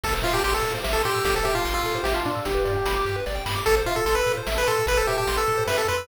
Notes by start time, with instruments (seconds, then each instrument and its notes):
0.04 synth bass 1 A1, lead 1 (square) A4, kick, crash
0.14 lead 1 (square) C5
0.22 synth bass 1 A2, lead 1 (square) F4 E5, closed hi-hat
0.34 lead 1 (square) G4 A5
0.43 synth bass 1 A1, lead 1 (square) G4 C6, closed hi-hat
0.54 lead 1 (square) A4 E6
0.62 synth bass 1 A2, lead 1 (square) A4, closed hi-hat
0.74 lead 1 (square) C5
0.84 synth bass 1 A1, lead 1 (square) E5, snare
0.93 lead 1 (square) A4 A5
1.04 synth bass 1 A2, lead 1 (square) G4 C6, closed hi-hat
1.15 lead 1 (square) E6
1.24 synth bass 1 A1, lead 1 (square) G4 A4, kick, closed hi-hat
1.35 lead 1 (square) A4 C5
1.44 synth bass 1 A2, lead 1 (square) G4 E5, closed hi-hat
1.55 lead 1 (square) F4 A5
1.65 synth bass 1 A1, lead 1 (square) C6, closed hi-hat
1.74 lead 1 (square) F4 E6
1.84 synth bass 1 A2, lead 1 (square) A4, closed hi-hat
1.95 lead 1 (square) C5
2.04 synth bass 1 A1, lead 1 (square) G4 E5, snare
2.14 lead 1 (square) F4 A5
2.25 synth bass 1 A2, lead 1 (square) D4 C6, closed hi-hat
2.35 lead 1 (square) E6
2.45 synth bass 1 G1, lead 1 (square) G4, kick, closed hi-hat
2.55 lead 1 (square) B4
2.65 synth bass 1 G2, lead 1 (square) D5, closed hi-hat
2.76 lead 1 (square) G5
2.85 synth bass 1 G1, lead 1 (square) B5, closed hi-hat
2.96 lead 1 (square) D6
3.05 synth bass 1 G2, lead 1 (square) G4, closed hi-hat
3.16 lead 1 (square) B4
3.26 synth bass 1 G1, lead 1 (square) D5, kick, snare
3.35 lead 1 (square) G5
3.46 synth bass 1 G2, lead 1 (square) B5, snare
3.56 lead 1 (square) D6
3.66 synth bass 1 A1, lead 1 (square) A4, kick, closed hi-hat
3.77 lead 1 (square) C5
3.86 synth bass 1 A2, lead 1 (square) F4 E5, closed hi-hat
3.96 lead 1 (square) A4 A5
4.05 synth bass 1 A1, lead 1 (square) A4 C6, closed hi-hat
4.15 lead 1 (square) B4 E6
4.26 synth bass 1 A2, lead 1 (square) A4, closed hi-hat
4.37 lead 1 (square) C5
4.47 synth bass 1 A1, lead 1 (square) E5, snare
4.56 lead 1 (square) B4 A5
4.66 synth bass 1 A2, lead 1 (square) A4 C6, closed hi-hat
4.77 lead 1 (square) E6
4.86 synth bass 1 A1, lead 1 (square) A4 B4, kick, closed hi-hat
4.97 lead 1 (square) A4 C5
5.07 synth bass 1 A2, lead 1 (square) G4 E5, closed hi-hat
5.17 lead 1 (square) G4 A5
5.27 synth bass 1 A1, lead 1 (square) C6, closed hi-hat
5.37 lead 1 (square) A4 E6
5.47 synth bass 1 A2, lead 1 (square) A4, closed hi-hat
5.57 lead 1 (square) C5
5.67 synth bass 1 F#2, lead 1 (square) B4 E5, snare
5.78 lead 1 (square) A4 A5
5.88 synth bass 1 F2, lead 1 (square) B4 C6, closed hi-hat
5.97 lead 1 (square) E6